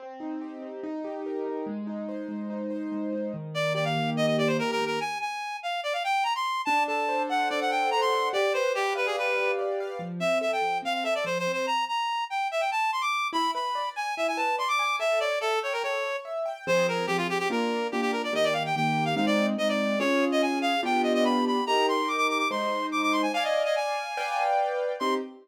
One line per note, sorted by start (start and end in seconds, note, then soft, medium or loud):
0.00 0.62 C4 medium
0.20 0.80 D#4 medium
0.41 0.81 G4 medium
0.62 0.82 C4 medium
0.83 1.45 D#4 medium
1.04 1.64 G4 medium
1.26 1.66 A#4 medium
1.46 1.66 D#4 medium
1.67 2.28 G#3 medium
1.87 2.50 D#4 medium
2.09 2.70 C5 medium
2.28 2.91 G#3 medium
2.50 3.12 D#4 medium
2.70 3.30 C5 medium
2.92 3.31 G#3 medium
3.13 3.33 D#4 medium
3.34 3.96 D#3 medium
3.54 4.15 A#3 medium
3.54 3.73 D5 loud
3.74 4.38 G4 medium
3.74 3.85 D5 medium
3.84 4.10 F5 medium
3.96 4.59 D#3 medium
4.16 4.78 A#3 medium
4.16 4.26 D#5 loud
4.27 4.37 D#5 medium
4.38 4.97 G4 medium
4.38 4.48 D5 loud
4.47 4.57 C5 medium
4.59 4.99 D#3 medium
4.59 4.71 A#4 loud
4.71 4.85 A#4 loud
4.79 4.99 A#3 medium
4.86 5.00 A#4 medium
5.00 5.18 G#5 loud
5.21 5.57 G#5 medium
5.63 5.81 F5 medium
5.83 5.93 D5 medium
5.93 6.03 F5 medium
6.04 6.24 G5 loud
6.24 6.33 A#5 loud
6.35 6.62 C6 loud
6.65 7.50 D4 loud
6.65 6.83 A5 loud
6.88 7.70 A4 medium
6.88 7.23 A5 medium
7.09 7.92 C5 medium
7.30 8.12 F#5 medium
7.30 7.49 F#5 medium
7.50 8.30 D4 medium
7.50 7.60 D5 loud
7.61 7.71 F#5 loud
7.70 8.29 A4 medium
7.70 7.90 G5 loud
7.91 8.32 C5 medium
7.91 8.01 A#5 loud
8.01 8.29 C6 loud
8.12 8.32 F#5 medium
8.33 9.17 G4 loud
8.33 8.53 D5 loud
8.54 9.37 B4 medium
8.54 8.72 C5 loud
8.75 8.93 G4 loud
8.75 9.58 D5 medium
8.95 9.06 B4 medium
8.95 9.80 F5 medium
9.06 9.16 G#4 medium
9.17 9.97 G4 medium
9.17 9.51 B4 medium
9.37 9.97 B4 medium
9.59 9.98 D5 medium
9.80 10.00 F5 medium
9.99 10.20 F3 medium
10.20 10.41 C4 medium
10.20 10.39 E5 loud
10.41 10.62 A4 medium
10.41 10.51 E5 medium
10.52 10.78 G5 medium
10.62 10.82 F3 medium
10.82 11.03 C4 medium
10.82 10.93 F5 loud
10.94 11.04 F5 medium
11.04 11.25 A4 medium
11.04 11.14 E5 loud
11.15 11.25 D5 medium
11.24 11.45 F3 medium
11.24 11.38 C5 loud
11.39 11.52 C5 loud
11.47 11.66 C4 medium
11.53 11.66 C5 medium
11.66 11.85 A#5 loud
11.88 12.24 A#5 medium
12.30 12.48 G5 medium
12.51 12.61 E5 medium
12.60 12.70 G5 medium
12.71 12.91 A5 loud
12.92 13.02 C6 loud
13.01 13.28 D6 loud
13.33 13.53 E4 loud
13.33 13.51 B5 loud
13.54 13.76 B4 medium
13.54 13.89 B5 medium
13.75 13.96 D5 medium
13.96 14.17 G#5 medium
13.96 14.15 G#5 medium
14.17 14.38 E4 medium
14.17 14.27 E5 loud
14.28 14.38 G#5 loud
14.37 14.58 B4 medium
14.37 14.56 A5 loud
14.58 14.79 D5 medium
14.58 14.68 C6 loud
14.68 14.96 D6 loud
14.79 14.99 G#5 medium
14.99 15.20 A4 loud
14.99 15.19 E5 loud
15.20 15.42 C#5 medium
15.20 15.39 D5 loud
15.41 15.59 A4 loud
15.41 15.63 E5 medium
15.63 15.73 C#5 medium
15.63 15.84 G5 medium
15.73 15.83 A#4 medium
15.83 16.04 A4 medium
15.83 16.17 C#5 medium
16.04 16.25 C#5 medium
16.25 16.46 E5 medium
16.46 16.65 G5 medium
16.67 17.05 F3 loud
16.67 17.05 C4 loud
16.67 17.05 G#4 loud
16.67 16.87 C5 loud
16.88 17.06 A#4 medium
17.07 17.46 F3 medium
17.07 17.46 C4 medium
17.07 17.17 G4 loud
17.07 17.46 G#4 medium
17.17 17.27 F4 loud
17.30 17.38 G4 loud
17.39 17.48 G4 loud
17.50 17.88 A#3 loud
17.50 17.88 D4 medium
17.50 17.88 F4 loud
17.50 17.87 A#4 medium
17.92 18.30 A#3 medium
17.92 18.30 D4 medium
17.92 18.30 F4 medium
17.92 18.01 G4 medium
18.01 18.11 G4 loud
18.12 18.22 A#4 medium
18.24 18.34 D5 medium
18.33 18.70 D#3 loud
18.33 18.70 A#3 medium
18.33 18.70 G4 medium
18.33 18.45 D#5 loud
18.44 18.54 D5 loud
18.53 18.63 F5 medium
18.66 18.75 G5 medium
18.76 19.13 D#3 medium
18.76 19.13 A#3 medium
18.76 19.13 G4 medium
18.76 19.05 G5 loud
19.05 19.15 F5 medium
19.16 19.54 G#3 loud
19.16 19.54 C4 loud
19.16 19.54 D#4 medium
19.16 19.26 F5 medium
19.26 19.46 D5 loud
19.58 19.95 G#3 medium
19.58 19.95 C4 medium
19.58 19.95 D#4 medium
19.58 19.68 D#5 loud
19.69 19.99 D5 medium
19.99 20.75 C#4 loud
19.99 20.75 F4 medium
19.99 20.75 G#4 loud
19.99 20.25 C#5 loud
20.32 20.42 D#5 loud
20.42 20.59 G#5 medium
20.62 20.81 F5 loud
20.83 21.58 B3 loud
20.83 21.58 D4 loud
20.83 21.58 F4 loud
20.83 21.58 G4 loud
20.83 21.02 G5 loud
21.03 21.13 D#5 medium
21.14 21.24 D#5 loud
21.24 21.45 B5 loud
21.47 21.64 B5 medium
21.67 22.43 D#4 medium
21.67 22.43 G4 medium
21.67 22.43 A#4 loud
21.67 21.86 A#5 loud
21.88 22.09 C6 medium
22.08 22.17 D6 medium
22.17 22.27 D6 loud
22.29 22.38 D6 loud
22.38 22.48 D6 loud
22.51 23.26 G#3 medium
22.51 23.26 D#4 loud
22.51 23.26 C5 medium
22.51 22.86 C6 medium
22.92 23.02 D6 medium
23.03 23.13 D6 loud
23.12 23.22 C6 loud
23.22 23.32 G#5 medium
23.34 24.09 D5 loud
23.34 23.44 F5 loud
23.34 24.09 F5 medium
23.34 24.09 G#5 loud
23.44 23.63 D#5 medium
23.65 23.75 D#5 medium
23.76 24.43 G#5 loud
24.17 24.92 B4 medium
24.17 24.92 D5 loud
24.17 24.92 F5 medium
24.17 24.92 G5 loud
25.00 25.16 C4 loud
25.00 25.16 D#4 medium
25.00 25.16 G4 loud
25.00 25.14 C6 loud